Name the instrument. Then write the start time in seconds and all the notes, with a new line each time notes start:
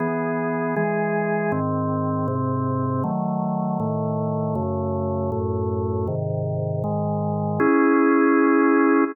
drawbar organ
0.00 E3 B3 G#4
0.76 E3 G#3 G#4
1.52 G#2 D#3 C4
2.28 G#2 C3 C4
3.04 D#3 F#3 A3
3.80 A2 D#3 A3
4.55 F#2 C#3 A3
5.32 F#2 A2 A3
6.07 G#2 C3 D#3
6.84 G#2 D#3 G#3
7.60 C#4 E4 G#4